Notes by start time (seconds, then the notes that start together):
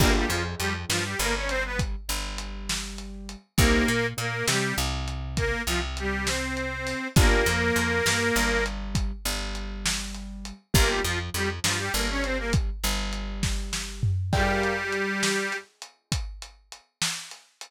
0.00 G1 A#3 D4 F4 G4 A#4, kick, crash
0.16 G3 G4
0.29 F2 F3 F4, closed hi-hat
0.59 F2 F3 G3 G4, closed hi-hat
0.89 G2 F3 G3 F4, snare
1.05 G3 G4
1.19 G1 G3 A#3 A#4, closed hi-hat
1.36 C#4 C#5
1.49 C4 C5, closed hi-hat
1.65 B3 B4
1.79 kick, closed hi-hat
2.08 G1 G3, closed hi-hat
2.38 closed hi-hat
2.69 snare
2.98 closed hi-hat
3.29 closed hi-hat
3.58 C2 A#3 C4 D#4 G4 A#4, kick, closed hi-hat
3.88 A#2 A#3, closed hi-hat
4.17 A#2 A#3 A#4, closed hi-hat
4.48 C3 G3 C4 G4, snare
4.77 C2 C3, closed hi-hat
5.08 closed hi-hat
5.37 A#3 A#4, kick, closed hi-hat
5.66 C2 C3 F3 F4, closed hi-hat
5.97 G3 G4, closed hi-hat
6.25 C4 C5, snare
6.57 closed hi-hat
6.87 open hi-hat
7.16 G1 A#3 D4 F4 G4 A#4, kick, closed hi-hat
7.46 F2 F3, closed hi-hat
7.76 F2 F3, closed hi-hat
8.05 G2 G3, snare
8.36 G1 G3, closed hi-hat
8.66 closed hi-hat
8.95 kick, closed hi-hat
9.25 G1 G3, closed hi-hat
9.55 closed hi-hat
9.86 snare
10.15 closed hi-hat
10.45 closed hi-hat
10.74 G1 A#3 D4 F4 G4 A#4, kick, closed hi-hat
10.88 G3 G4
11.04 F2 F3 F4, closed hi-hat
11.34 F2 F3 G3 G4, closed hi-hat
11.64 G2 F3 G3 F4, snare
11.78 G3 G4
11.94 G1 G3 A#3 A#4, closed hi-hat
12.10 C#4 C#5
12.23 C4 C5, closed hi-hat
12.38 A#3 A#4
12.53 kick, closed hi-hat
12.83 G1 G3, closed hi-hat
13.13 closed hi-hat
13.43 kick, snare
13.73 snare
14.03 floor tom
14.33 G3 G4 A#4 D5 F5 G5, kick, crash
14.63 closed hi-hat
14.92 closed hi-hat
15.23 snare
15.52 closed hi-hat
15.82 closed hi-hat
16.12 kick, closed hi-hat
16.42 closed hi-hat
16.72 closed hi-hat
17.02 snare
17.31 closed hi-hat
17.61 closed hi-hat